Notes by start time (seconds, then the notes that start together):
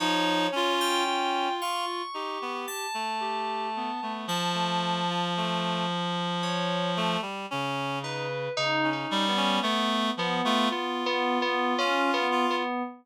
0.00 F3 D#4 C#5
0.52 C#4 F4
0.81 G5
1.06 F4
1.61 F4 C#6
2.14 D#4 G4
2.42 B3
2.68 A5
2.94 A3
3.20 G4
3.76 B3
4.02 A3 B3
4.27 F3 A5
4.54 A3
5.10 F4
5.37 A3
6.43 C#5
6.97 A3
7.22 G3
7.51 C#3 C#4
8.03 D#4 B4
8.57 C#3 D#4
8.84 C#4
8.93 D#4
9.09 G3 C#4
9.29 B3
9.37 C#4
9.62 A3 B3
10.17 F3 B3
10.45 A3 F4
10.70 B3 F4
11.06 B3
11.42 B3
11.78 C#4 F4
12.14 B3
12.31 F4
12.50 B3